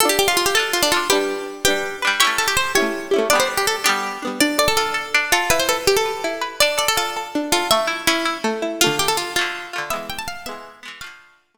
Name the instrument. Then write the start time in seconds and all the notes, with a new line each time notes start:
pizzicato strings
0.00 F4 A4
0.05 D4
0.09 G4
0.19 G4
0.28 F4
0.37 F4
0.46 G4
0.55 F4 A4
0.59 D4
0.73 F4
0.82 D4
0.92 F4 A4
0.97 D4
1.10 D4 G4 B4
1.15 G3
1.65 D4 G4 B4
1.70 G3
2.02 D4 B4
2.07 G3
2.20 E4 G4 C#5
2.25 A3 C#4
2.38 A4
2.48 G4
2.57 C5
2.75 E4 G4 C#5
2.80 A3 C#4
3.11 E4 G4
3.16 A3 C#4
3.30 B3 D4 D5
3.35 G3
3.40 C5
3.57 G4
3.67 A4
3.84 B3 D4 G4
3.89 G3
4.22 B3 D4
4.27 G3
4.40 D4 D5
4.58 A4 D5
4.68 A4
4.77 F4 A4
4.94 A4
5.14 D4
5.32 F4 A4
5.50 E4 B4
5.59 C5
5.69 A4 B4
5.87 G4
5.97 A4
6.06 B4
6.24 E4
6.41 B4
6.60 D4 D5
6.78 A4 D5
6.88 A4
6.97 F4 A4
7.17 A4
7.35 D4
7.52 F4 A4
7.71 A3 E5
7.87 E4
8.07 C#4 E4
8.25 E4
8.44 A3
8.62 E4
8.81 A3 F4
8.86 D3
8.99 G4
9.08 A4
9.17 F4
9.36 A3 F4
9.41 D3
9.73 A3 F4
9.78 D3
9.90 G#3 B3 E5
9.96 E3
10.10 G5
10.19 A5
10.28 F5
10.46 G#3 B3 E5
10.51 E3
10.83 G#3 B3
10.88 E3
11.01 F3 A3 F5
11.06 D3
11.54 F3 A3